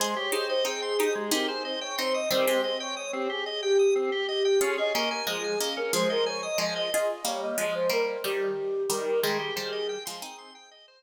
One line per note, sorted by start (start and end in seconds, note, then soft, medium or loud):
0.00 0.15 G#3 loud
0.00 0.28 G#4 medium
0.00 0.16 C5 loud
0.00 0.28 C5 medium
0.16 0.31 G4 medium
0.16 0.33 C#5 medium
0.32 0.62 D#4 medium
0.32 0.62 G4 medium
0.32 0.48 G#4 medium
0.32 0.48 C5 medium
0.49 0.65 C5 medium
0.49 0.64 D#5 medium
0.65 0.96 C4 medium
0.65 0.96 D#4 medium
0.65 1.13 G#4 medium
0.65 0.81 G5 medium
0.82 0.97 C6 medium
0.99 1.31 D#4 medium
0.99 1.31 G4 medium
0.99 1.14 D#6 medium
1.15 1.30 G#3 medium
1.15 1.31 G#4 medium
1.31 1.88 C4 medium
1.31 1.88 D#4 medium
1.31 1.47 G4 medium
1.31 1.48 A#4 medium
1.48 1.63 G#4 medium
1.48 1.63 C5 medium
1.64 1.80 C5 medium
1.64 1.80 D#5 medium
1.80 1.96 C#5 medium
1.80 1.96 G5 medium
1.98 2.28 C4 medium
1.98 2.28 D#4 medium
1.98 2.14 C5 medium
1.98 2.13 C6 loud
2.14 2.29 D#5 medium
2.14 2.29 D#6 medium
2.30 2.46 D#3 medium
2.30 2.46 G3 loud
2.30 2.46 C4 loud
2.30 2.61 C5 loud
2.47 3.49 G#3 medium
2.47 3.49 C4 medium
2.47 2.62 G4 medium
2.64 2.80 C5 medium
2.64 2.79 D#5 medium
2.80 2.96 C#5 medium
2.80 2.95 G5 medium
2.97 3.13 C#5 medium
2.97 3.12 D#6 medium
3.13 3.28 C4 medium
3.13 3.29 G4 medium
3.30 3.45 G4 medium
3.30 3.62 G#4 medium
3.46 3.61 D#5 medium
3.62 4.23 G4 medium
3.62 3.77 G5 medium
3.79 3.94 D#6 medium
3.96 4.10 C4 medium
4.12 4.27 G4 medium
4.28 4.58 G4 medium
4.28 4.43 D#5 medium
4.45 4.60 G5 medium
4.61 4.76 C#4 loud
4.61 4.92 F4 medium
4.61 4.92 G#4 medium
4.61 4.77 C#5 medium
4.78 4.93 G#4 medium
4.78 4.94 D#5 medium
4.94 5.22 A#3 medium
4.94 5.22 C#4 medium
4.94 5.10 A#4 loud
4.94 5.09 D#5 medium
5.11 5.27 A#4 medium
5.11 5.26 G#5 medium
5.27 5.55 F3 medium
5.27 5.55 G#3 medium
5.27 5.69 G#4 medium
5.27 5.42 D#6 medium
5.44 5.59 G#5 medium
5.60 5.93 A#3 medium
5.60 5.93 C#4 medium
5.60 5.75 D#5 medium
5.77 5.92 C#4 medium
5.77 5.92 A#4 medium
5.93 6.48 F3 medium
5.93 6.48 G#3 medium
5.93 6.08 G#4 medium
5.93 6.09 C5 medium
6.10 6.26 A#4 medium
6.10 6.25 D#5 medium
6.26 6.42 C#5 medium
6.26 6.41 G#5 medium
6.43 6.58 D#5 medium
6.43 6.58 D#6 medium
6.58 6.89 F3 medium
6.58 6.89 G#3 medium
6.58 6.75 D#5 medium
6.58 6.74 G#5 medium
6.76 6.91 D#5 medium
6.76 6.92 D#5 medium
6.92 7.22 F4 medium
6.92 7.22 G#4 medium
6.92 7.24 D#5 loud
7.25 7.56 G3 medium
7.25 7.56 A#3 medium
7.25 7.41 C#5 medium
7.41 7.57 D#5 medium
7.58 7.88 F3 medium
7.58 7.88 G#3 medium
7.58 7.74 D#5 medium
7.74 7.90 C5 medium
7.90 8.17 G3 medium
7.90 8.17 A#3 medium
7.90 8.23 A#4 medium
8.24 8.86 D#3 medium
8.24 8.86 G3 medium
8.24 8.82 G4 medium
8.90 9.21 D#3 medium
8.90 9.21 G3 medium
8.90 9.20 A#4 medium
9.23 9.51 D#3 medium
9.23 9.51 G3 medium
9.23 9.38 G#3 loud
9.23 10.51 G#4 loud
9.40 9.54 G4 medium
9.56 9.98 D#3 medium
9.56 9.98 G3 medium
9.56 9.71 C5 medium
9.73 9.87 D#5 medium
9.89 10.04 G5 medium
10.05 10.23 F3 medium
10.05 10.23 G#3 medium
10.05 10.20 C6 medium
10.22 10.79 C4 medium
10.22 10.79 D#4 medium
10.22 10.37 D#6 medium
10.38 10.53 C6 medium
10.55 10.70 G5 medium
10.71 10.86 D#5 medium
10.88 11.03 C5 medium